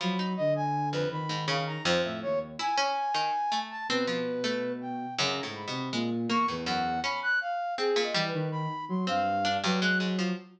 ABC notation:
X:1
M:7/8
L:1/16
Q:1/4=81
K:none
V:1 name="Flute"
b2 ^d ^g2 B b2 f ^a c e ^c z | ^g6 a B5 =g2 | ^a2 b2 z2 ^c' B ^f2 b ^f' =f2 | (3^G2 ^d2 B2 b2 c' f3 B ^f' z2 |]
V:2 name="Harpsichord"
F, ^D4 F,,2 ^G,, ^C,2 F,,4 | E ^C2 ^D, z A,2 =C F,2 A,4 | (3^F,,2 A,,2 B,,2 ^G, z ^A, =A,, F,,2 ^C4 | C ^A,, G,5 C2 D G,, ^G, ^G,, F, |]
V:3 name="Ocarina" clef=bass
^F,2 D,4 ^D,4 z A,, ^D,,2 | z7 B,,7 | (3^C,2 ^G,,2 =C,2 ^A,,2 E,, E,,3 z4 | z2 E, ^D,2 z ^F, G,,3 F,4 |]